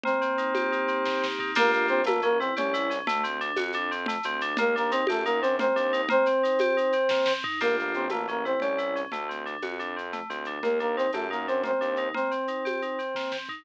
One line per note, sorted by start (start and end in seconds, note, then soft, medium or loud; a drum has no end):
0.04 1.05 A#3 loud
0.04 1.26 C4 medium
0.04 1.26 C5 medium
0.04 low conga loud
0.04 shaker medium
0.21 0.88 C4 medium
0.21 shaker medium
0.38 0.72 D#4 medium
0.38 shaker medium
0.55 1.51 G4 medium
0.55 tambourine medium
0.55 high conga medium
0.55 shaker medium
0.72 1.39 D#4 medium
0.72 shaker medium
0.88 1.22 C4 medium
0.88 shaker medium
1.05 1.53 A#3 medium
1.05 kick medium
1.05 snare medium
1.22 1.54 C4 medium
1.22 snare medium
1.39 1.56 D#4 medium
1.39 floor tom loud
1.55 1.88 G1 loud
1.55 2.01 A#3 loud
1.55 1.71 A#3 loud
1.55 2.01 D4 loud
1.55 2.01 F4 loud
1.55 2.01 G4 loud
1.55 1.71 A#4 loud
1.55 crash loud
1.55 low conga loud
1.55 shaker medium
1.71 1.87 A#3 medium
1.71 1.87 A#4 medium
1.71 shaker medium
1.88 2.49 A1 loud
1.88 2.04 C4 medium
1.88 2.04 C5 loud
1.88 shaker medium
2.04 2.23 A3 loud
2.04 2.21 A#3 medium
2.04 2.21 A#4 medium
2.04 tambourine medium
2.04 high conga loud
2.04 shaker loud
2.22 2.39 A#3 medium
2.22 2.40 C#4 loud
2.22 2.39 A#4 loud
2.22 shaker medium
2.39 2.54 C4 medium
2.39 2.57 E4 medium
2.39 2.54 C5 loud
2.39 shaker medium
2.56 3.00 C2 medium
2.56 2.98 C#4 medium
2.56 2.73 G4 medium
2.56 2.98 C#5 medium
2.56 low conga loud
2.56 shaker loud
2.74 2.90 E4 loud
2.74 shaker loud
2.90 3.06 C#4 medium
2.90 shaker medium
3.07 3.50 D2 loud
3.07 3.24 A3 loud
3.07 low conga loud
3.07 shaker loud
3.24 3.41 C4 medium
3.24 shaker medium
3.41 3.58 D4 loud
3.41 shaker medium
3.56 4.15 F2 loud
3.56 3.74 F#4 medium
3.56 tambourine medium
3.56 high conga medium
3.56 shaker medium
3.72 3.91 D4 loud
3.72 shaker medium
3.91 4.08 C4 medium
3.91 shaker medium
4.06 4.25 A3 loud
4.06 low conga loud
4.06 shaker loud
4.23 4.53 D2 loud
4.23 4.42 C4 loud
4.23 shaker medium
4.41 4.58 D4 loud
4.41 shaker medium
4.57 5.01 D#2 loud
4.57 4.75 A#3 loud
4.57 4.75 A#4 loud
4.57 low conga loud
4.57 shaker loud
4.76 4.92 A#3 medium
4.76 4.92 D4 loud
4.76 4.92 A#4 loud
4.76 shaker medium
4.91 5.05 C4 medium
4.91 5.09 D#4 loud
4.91 5.05 C5 loud
4.91 shaker loud
5.07 5.66 F#2 loud
5.07 5.23 A3 medium
5.07 5.25 G4 medium
5.07 5.23 A4 medium
5.07 tambourine medium
5.07 high conga loud
5.07 shaker medium
5.25 5.40 A#3 medium
5.25 5.43 D#4 loud
5.25 5.40 A#4 medium
5.25 shaker medium
5.41 5.56 C4 medium
5.41 5.59 D4 medium
5.41 5.56 C5 medium
5.41 shaker medium
5.59 5.76 A#3 medium
5.59 6.02 C4 medium
5.59 6.02 C5 medium
5.59 low conga loud
5.59 shaker medium
5.76 6.05 D#2 loud
5.76 5.93 D4 loud
5.76 shaker medium
5.93 6.09 D#4 loud
5.93 shaker medium
6.09 6.26 A#3 loud
6.09 7.33 C4 loud
6.09 7.33 C5 loud
6.09 low conga loud
6.09 shaker medium
6.26 6.43 C4 medium
6.26 shaker medium
6.43 6.60 D#4 medium
6.43 shaker loud
6.59 6.77 G4 loud
6.59 tambourine medium
6.59 high conga loud
6.59 shaker medium
6.77 6.94 D#4 medium
6.77 shaker medium
6.92 7.10 C4 medium
6.92 shaker medium
7.09 7.27 A#3 medium
7.09 kick loud
7.09 snare loud
7.26 7.44 C4 medium
7.26 snare loud
7.44 7.60 D#4 loud
7.44 floor tom loud
7.61 7.93 G1 medium
7.61 8.06 A#3 medium
7.61 7.76 A#3 medium
7.61 8.06 D4 medium
7.61 8.06 F4 medium
7.61 8.06 G4 medium
7.61 7.76 A#4 medium
7.61 crash medium
7.61 low conga medium
7.61 shaker medium
7.79 7.94 A#3 medium
7.79 7.94 A#4 medium
7.79 shaker medium
7.94 8.54 A1 medium
7.94 8.10 C4 medium
7.94 8.10 C5 medium
7.94 shaker medium
8.09 8.28 A3 medium
8.09 8.27 A#3 medium
8.09 8.27 A#4 medium
8.09 tambourine medium
8.09 high conga medium
8.09 shaker medium
8.28 8.45 A#3 medium
8.28 8.45 C#4 medium
8.28 8.45 A#4 medium
8.28 shaker medium
8.45 8.60 C4 medium
8.45 8.62 E4 medium
8.45 8.60 C5 medium
8.45 shaker medium
8.60 9.05 C2 medium
8.60 9.02 C#4 medium
8.60 8.79 G4 medium
8.60 9.02 C#5 medium
8.60 low conga medium
8.60 shaker medium
8.78 8.95 E4 medium
8.78 shaker medium
8.96 9.12 C#4 medium
8.96 shaker medium
9.12 9.55 D2 medium
9.12 9.29 A3 medium
9.12 low conga medium
9.12 shaker medium
9.29 9.46 C4 medium
9.29 shaker medium
9.46 9.63 D4 medium
9.46 shaker medium
9.62 10.20 F2 medium
9.62 9.79 F#4 medium
9.62 tambourine medium
9.62 high conga medium
9.62 shaker medium
9.79 9.96 D4 medium
9.79 shaker medium
9.97 10.13 C4 medium
9.97 shaker medium
10.13 10.30 A3 medium
10.13 low conga medium
10.13 shaker medium
10.30 10.58 D2 medium
10.30 10.47 C4 medium
10.30 shaker medium
10.45 10.63 D4 medium
10.45 shaker medium
10.63 11.06 D#2 medium
10.63 10.79 A#3 medium
10.63 10.80 A#3 medium
10.63 10.79 A#4 medium
10.63 low conga medium
10.63 shaker medium
10.80 10.96 A#3 medium
10.80 10.97 D4 medium
10.80 10.96 A#4 medium
10.80 shaker medium
10.96 11.11 C4 medium
10.96 11.14 D#4 medium
10.96 11.11 C5 medium
10.96 shaker medium
11.13 11.71 F#2 medium
11.13 11.27 A3 medium
11.13 11.31 G4 medium
11.13 11.27 A4 medium
11.13 tambourine medium
11.13 high conga medium
11.13 shaker medium
11.31 11.46 A#3 medium
11.31 11.47 D#4 medium
11.31 11.46 A#4 medium
11.31 shaker medium
11.47 11.62 C4 medium
11.47 11.65 D4 medium
11.47 11.62 C5 medium
11.47 shaker medium
11.64 11.81 A#3 medium
11.64 12.08 C4 medium
11.64 12.08 C5 medium
11.64 low conga medium
11.64 shaker medium
11.81 12.10 D#2 medium
11.81 11.98 D4 medium
11.81 shaker medium
11.96 12.14 D#4 medium
11.96 shaker medium
12.14 12.31 A#3 medium
12.14 13.37 C4 medium
12.14 13.37 C5 medium
12.14 low conga medium
12.14 shaker medium
12.31 12.48 C4 medium
12.31 shaker medium
12.47 12.65 D#4 medium
12.47 shaker medium
12.65 12.82 G4 medium
12.65 tambourine medium
12.65 high conga medium
12.65 shaker medium
12.82 12.99 D#4 medium
12.82 shaker medium
12.99 13.15 C4 medium
12.99 shaker medium
13.15 13.32 A#3 medium
13.15 kick medium
13.15 snare medium
13.32 13.49 C4 medium
13.32 snare medium
13.49 13.65 D#4 medium
13.49 floor tom medium